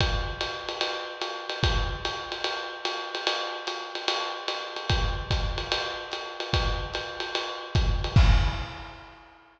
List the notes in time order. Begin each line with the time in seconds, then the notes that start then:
0.01 kick, ride
0.41 hi-hat pedal, ride
0.69 ride
0.81 ride
1.21 hi-hat pedal, ride
1.49 ride
1.63 kick, ride
2.05 hi-hat pedal, ride
2.32 ride
2.44 ride
2.85 hi-hat pedal, ride
3.15 ride
3.27 ride
3.67 hi-hat pedal, ride
3.95 ride
4.08 ride
4.48 hi-hat pedal, ride
4.76 ride
4.89 kick, ride
5.31 kick, hi-hat pedal, ride
5.58 ride
5.72 ride
6.12 hi-hat pedal, ride
6.40 ride
6.53 kick, ride
6.94 hi-hat pedal, ride
7.20 ride
7.35 ride
7.75 kick, hi-hat pedal, ride
8.04 ride
8.16 kick, crash